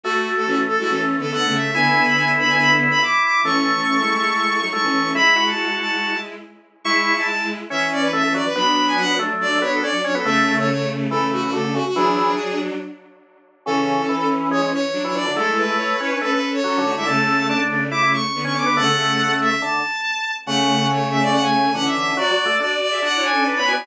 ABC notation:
X:1
M:4/4
L:1/16
Q:1/4=141
K:F#m
V:1 name="Violin"
F3 A F z A F A z2 A f2 e2 | g3 b g z b g b z2 b d'2 d'2 | c'12 c'4 | b3 a3 a4 z6 |
[K:A] c'3 a a2 z2 e2 d B e2 d B | b3 g f2 z2 d2 c A d2 c A | e3 c c2 z2 A2 F F A2 F F | G6 z10 |
A6 z2 c2 c3 c d2 | A2 B6 B B2 c4 e | a6 z2 d'2 c'3 c' d'2 | f6 e2 a8 |
[K:F#m] f4 c2 e d f g3 f e e2 | d4 d2 d2 f2 g2 z b g2 |]
V:2 name="Violin"
[A,F]4 [E,C]2 z [G,E] (3[E,C]4 [D,B,]4 [C,A,]4 | [D,B,]12 z4 | [E,C]3 [E,C] [E,C] [G,E] [G,E] [G,E]4 [F,^D] [G,E] [E,C]3 | [G,E]12 z4 |
[K:A] [G,E]8 [E,C]8 | [F,D]8 [F,D]8 | [C,A,]8 [C,A,]8 | [F,D]8 z8 |
[E,C]12 [F,D]4 | [G,E]4 [Ec]2 [Ec] [DB] [CA]4 [CA]2 [A,F] [G,E] | [C,A,]6 [C,A,]6 [D,B,]4 | [C,A,] [C,A,] [C,A,]6 z8 |
[K:F#m] [C,A,]12 [E,C]4 | [Fd]2 [Fd]2 [Fd]3 [Ge] (3[Fd]2 [Ec]2 [CA]2 [DB] [Ec] [Fd] [Ec] |]
V:3 name="Drawbar Organ"
A,12 A,4 | E12 E4 | A,12 A,4 | E2 F8 z6 |
[K:A] E3 E z4 C4 A, A, F, z | B,6 A,4 B,2 C z C B, | A,3 A, z4 E,4 D, D, C, z | E,4 z12 |
C,4 E,4 G, G, z3 E, E, D, | A,6 C C A,2 z2 (3F,2 D,2 D,2 | A,4 D4 E E z3 C C B, | A,8 D,2 z6 |
[K:F#m] C,12 D,4 | (3F,2 F,2 A,2 D2 z2 D4 (3D2 B,2 B,2 |]